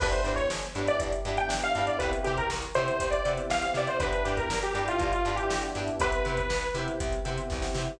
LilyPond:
<<
  \new Staff \with { instrumentName = "Lead 2 (sawtooth)" } { \time 4/4 \key g \mixolydian \tempo 4 = 120 b'16 c''8 cis''16 r8. d''16 r8. g''16 r16 f''8 d''16 | b'16 r16 g'16 ais'16 r8 c''8. d''8 r16 f''16 f''16 d''16 c''16 | b'8 g'16 ais'8 g'16 g'16 f'8 f'8 g'8 r8. | b'4. r2 r8 | }
  \new Staff \with { instrumentName = "Acoustic Guitar (steel)" } { \time 4/4 \key g \mixolydian <d' e' g' b'>8 <d' e' g' b'>4 <d' e' g' b'>4 <d' e' g' b'>4 <d' e' g' b'>8 | <e' g' b' c''>8 <e' g' b' c''>4 <e' g' b' c''>4 <e' g' b' c''>4 <e' g' b' c''>8 | <d' e' g' b'>8 <d' e' g' b'>4 <d' e' g' b'>4 <d' e' g' b'>4 <d' e' g' b'>8 | <e' g' b' c''>8 <e' g' b' c''>4 <e' g' b' c''>4 <e' g' b' c''>4 <e' g' b' c''>8 | }
  \new Staff \with { instrumentName = "Electric Piano 1" } { \time 4/4 \key g \mixolydian <b d' e' g'>4. <b d' e' g'>4 <b d' e' g'>8. <b d' e' g'>16 <b d' e' g'>8 | <b c' e' g'>4. <b c' e' g'>4 <b c' e' g'>8. <b c' e' g'>16 <b c' e' g'>8 | <b d' e' g'>4. <b d' e' g'>4 <b d' e' g'>8. <b d' e' g'>16 <b d' e' g'>8 | <b c' e' g'>4. <b c' e' g'>4 <b c' e' g'>8. <b c' e' g'>16 <b c' e' g'>8 | }
  \new Staff \with { instrumentName = "Electric Bass (finger)" } { \clef bass \time 4/4 \key g \mixolydian g,,8 g,8 g,,8 g,8 g,,8 g,8 g,,8 g,8 | c,8 c8 c,8 c8 c,8 c8 c,8 c8 | g,,8 g,8 g,,8 g,8 g,,8 g,8 g,,8 g,8 | c,8 c8 c,8 c8 c,8 c8 c,8 c8 | }
  \new DrumStaff \with { instrumentName = "Drums" } \drummode { \time 4/4 <cymc bd>16 hh16 hh16 <hh bd>16 sn16 hh16 hh16 <hh sn>16 <hh bd>16 hh16 hh16 hh16 sn16 hh16 <hh sn>16 hh16 | <hh bd>16 hh16 hh16 <hh bd>16 sn16 hh16 hh16 hh16 <hh bd>16 hh16 hh16 hh16 sn16 hh16 <hh sn>16 <hh sn>16 | <hh bd>16 hh16 hh16 <hh bd sn>16 sn16 hh16 hh16 <hh sn>16 <hh bd>16 hh16 hh16 hh16 sn16 hh16 <hh sn>16 hh16 | <hh bd>16 hh16 hh16 <hh bd>16 sn16 hh16 hh16 hh16 <hh bd>16 hh16 hh16 hh16 <bd sn>16 sn16 sn8 | }
>>